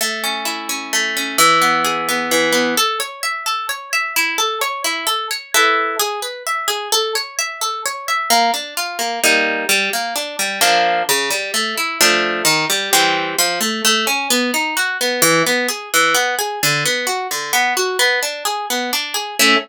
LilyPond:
\new Staff { \time 3/4 \key a \major \tempo 4 = 130 a8 cis'8 e'8 cis'8 a8 cis'8 | e8 b8 gis'8 b8 e8 b8 | a'8 cis''8 e''8 a'8 cis''8 e''8 | e'8 a'8 cis''8 e'8 a'8 cis''8 |
<e' a' b'>4 gis'8 b'8 e''8 gis'8 | a'8 cis''8 e''8 a'8 cis''8 e''8 | \key bes \major bes8 d'8 f'8 bes8 <g bes ees'>4 | g8 bes8 d'8 g8 <f bes d'>4 |
cis8 g8 a8 e'8 <f a d'>4 | ees8 g8 <e g c'>4 f8 a8 | \key a \major a8 cis'8 b8 dis'8 fis'8 b8 | e8 b8 gis'8 e8 b8 gis'8 |
d8 b8 fis'8 d8 b8 fis'8 | b8 d'8 gis'8 b8 d'8 gis'8 | <a cis' e'>4 r2 | }